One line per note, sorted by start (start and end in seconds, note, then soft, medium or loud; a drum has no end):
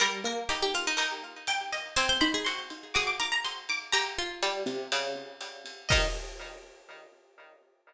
0.00 0.25 G3 medium
0.00 0.21 A#4 loud
0.00 ride medium
0.24 0.44 A#3 medium
0.24 0.89 A#4 medium
0.49 0.90 D#4 medium
0.49 0.61 G4 medium
0.49 hi-hat pedal medium
0.49 ride medium
0.62 0.74 G4 loud
0.74 0.86 F4 medium
0.74 ride medium
0.87 1.79 D#4 medium
0.97 1.83 D#4 medium
0.97 1.38 A#4 medium
0.97 ride loud
1.47 1.71 G5 medium
1.47 hi-hat pedal medium
1.47 ride medium
1.72 1.95 D#5 medium
1.72 ride medium
1.96 2.17 C4 medium
1.96 2.08 C5 loud
1.96 2.20 G#5 loud
1.96 ride loud
2.09 2.20 C5 medium
2.21 2.44 D#4 medium
2.21 2.33 C5 medium
2.21 2.41 B5 medium
2.34 2.46 G#4 medium
2.45 2.94 F#4 medium
2.45 2.66 C6 medium
2.45 hi-hat pedal medium
2.45 ride medium
2.70 ride medium
2.94 3.77 F#4 medium
2.94 3.18 G#4 medium
2.94 3.06 D6 medium
2.94 ride medium
3.07 3.19 D6 medium
3.20 3.64 A#4 medium
3.20 3.33 D6 medium
3.32 3.44 A#5 medium
3.45 3.68 C6 medium
3.45 hi-hat pedal medium
3.45 ride medium
3.69 3.90 D6 medium
3.69 ride medium
3.92 4.14 G4 loud
3.92 5.19 A#5 loud
3.92 ride loud
4.18 4.86 F4 medium
4.43 4.64 G3 medium
4.43 hi-hat pedal medium
4.43 ride medium
4.66 4.87 C3 medium
4.66 ride medium
4.92 5.36 C#3 medium
4.92 ride loud
5.41 hi-hat pedal medium
5.41 ride medium
5.66 ride medium
5.89 6.08 D#3 loud
5.89 6.09 D#4 loud
5.89 6.06 D#5 loud
5.89 kick loud
5.89 crash loud